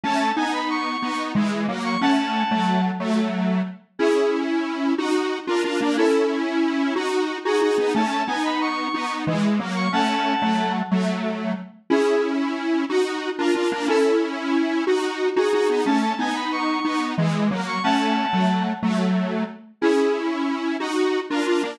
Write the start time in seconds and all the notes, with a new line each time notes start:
0.04 A3 C#4 A5
0.20 A5
0.36 B3 D#4 G#5
0.53 B5
0.70 C#6
1.02 B3 D#4
1.35 E3 G#3
1.68 F#3 A#3
1.84 C#6
2.01 A3 C#4 F#5 A5
2.51 F#3 A3
3.00 F#3 A3
3.99 C#4 E4 G#4
4.98 D#4 F#4
5.47 D4 F4 A#4
5.64 D4 F4
5.81 A#3 D4
5.97 C#4 E4 A4
6.96 D#4 F#4
7.45 D#4 F#4 G#4
7.62 D#4 F#4
7.78 B3 D#4
7.95 A3 C#4 A5
8.11 A5
8.27 B3 D#4 G#5
8.44 B5
8.61 C#6
8.94 B3 D#4
9.27 E3 G#3
9.59 F#3 A#3
9.76 C#6
9.93 A3 C#4 F#5 A5
10.42 F#3 A3
10.91 F#3 A3
11.90 C#4 E4 G#4
12.90 D#4 F#4
13.38 D4 F4 A#4
13.55 D4 F4
13.72 A#3 D4
13.88 C#4 E4 A4
14.87 D#4 F#4
15.36 D#4 F#4 G#4
15.53 D#4 F#4
15.69 B3 D#4
15.86 A3 C#4 A5
16.02 A5
16.19 B3 D#4 G#5
16.35 B5
16.52 C#6
16.85 B3 D#4
17.18 E3 G#3
17.51 F#3 A#3
17.67 C#6
17.83 A3 C#4 F#5 A5
18.33 F#3 A3
18.83 F#3 A3
19.81 C#4 E4 G#4
20.80 D#4 F#4
21.30 D4 F4 A#4
21.47 D4 F4
21.63 A#3 D4